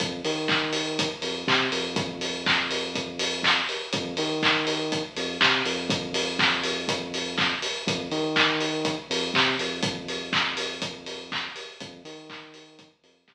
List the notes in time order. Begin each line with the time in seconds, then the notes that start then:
0.00 F2, kick, closed hi-hat
0.25 D#3, open hi-hat
0.48 kick, clap
0.73 open hi-hat
0.99 kick, closed hi-hat
1.22 F2, open hi-hat
1.48 C3, kick, clap
1.72 F2, open hi-hat
1.96 kick, closed hi-hat
2.21 open hi-hat
2.46 kick, clap
2.71 open hi-hat
2.95 kick, closed hi-hat
3.19 open hi-hat
3.43 kick, clap
3.69 open hi-hat
3.93 F2, kick, closed hi-hat
4.17 D#3, open hi-hat
4.43 kick, clap
4.67 open hi-hat
4.92 kick, closed hi-hat
5.16 F2, open hi-hat
5.41 C3, kick, clap
5.65 F2, open hi-hat
5.90 kick, closed hi-hat
6.14 open hi-hat
6.39 kick, clap
6.64 open hi-hat
6.88 kick, closed hi-hat
7.14 open hi-hat
7.38 kick, clap
7.62 open hi-hat
7.87 F2, kick, closed hi-hat
8.11 D#3, open hi-hat
8.36 kick, clap
8.61 open hi-hat
8.85 kick, closed hi-hat
9.10 F2, open hi-hat
9.34 C3, kick, clap
9.59 F2, open hi-hat
9.83 kick, closed hi-hat
10.08 open hi-hat
10.33 kick, clap
10.57 open hi-hat
10.82 kick, closed hi-hat
11.06 open hi-hat
11.32 kick, clap
11.56 open hi-hat
11.80 F2, kick, closed hi-hat
12.05 D#3, open hi-hat
12.30 kick, clap
12.54 open hi-hat
12.79 kick, closed hi-hat
13.03 F2, open hi-hat
13.28 C3, kick, clap